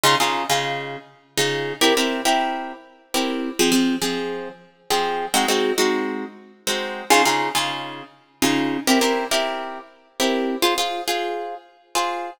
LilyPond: \new Staff { \time 6/8 \key f \minor \tempo 4. = 68 <des ees' f' aes'>16 <des ees' f' aes'>8 <des ees' f' aes'>4. <des ees' f' aes'>8. | <c' e' g' bes'>16 <c' e' g' bes'>8 <c' e' g' bes'>4. <c' e' g' bes'>8. | <f c' aes'>16 <f c' aes'>8 <f c' aes'>4. <f c' aes'>8. | <aes c' ees' ges'>16 <aes c' ees' ges'>8 <aes c' ees' ges'>4. <aes c' ees' ges'>8. |
<des ees' f' aes'>16 <des ees' f' aes'>8 <des ees' f' aes'>4. <des ees' f' aes'>8. | <c' e' g' bes'>16 <c' e' g' bes'>8 <c' e' g' bes'>4. <c' e' g' bes'>8. | <f' aes' c''>16 <f' aes' c''>8 <f' aes' c''>4. <f' aes' c''>8. | }